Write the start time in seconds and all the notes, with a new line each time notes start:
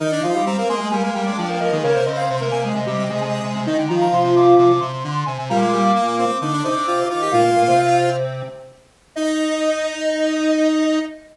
0.00 D#3 D#4 A#4
0.11 D4 D5
0.22 F3 D#4 F4 F5
0.34 G3 G4 F5
0.46 G3 C4 G4 A#5
0.57 A#3 C4 A#4
0.69 G#3 A#3 G#4 C6
0.80 G#3 G#4
0.91 G3 A#3 A#4 G#5
1.03 G#3 A#3 A#4
1.14 G3 A#3 A#4 G5
1.26 G#3 D4 D5
1.37 F3 D4 D5
1.49 A#3 A#4
1.60 F3 A#3 A#4 D#5
1.71 D#3 G#3 G#4 D#5
1.83 C#3 A#3 A#4 C#5
1.94 C3 C5
2.06 C#3 C4 C5 D#5
2.17 F5
2.29 C3 C4 C5
2.40 C3 A#3 A#4
2.51 C3 G#5
2.63 G#3 G#4 G#5
2.74 C3 D#5
2.86 C3 G3 G4
2.98 C3
3.09 C3 G#3 G#4
3.20 C3 G#3 G#4
3.44 C3
3.55 C3
3.66 D#3 D#4 D#5
3.78 D3 G5
3.88 D#3 F3 F4 A#5
4.01 A#5
4.12 C3 C6
4.24 C3
4.35 C3 D6
4.58 C3 D6
4.69 C3
4.80 C3 C6
4.92 C3
5.04 D3
5.26 C3 G#5
5.38 C3 G#5
5.50 A#2 G3 A#3 A#5
5.61 G#3 D6
5.73 G3 D6
5.83 D6
5.95 A#3 D6
6.07 A#3
6.18 C4 D6
6.41 D3 D4 D#4 D6
6.53 D4
6.64 C3 C4 D#4 D6
6.76 D4
6.87 F4
7.10 D#3 D#4 F4 D6
7.21 G4 D6
7.31 A#2 A#3 F4 F5
7.44 A#2 A#3
7.56 A#2 A#3
7.67 C3 C4
9.16 D#4 D#5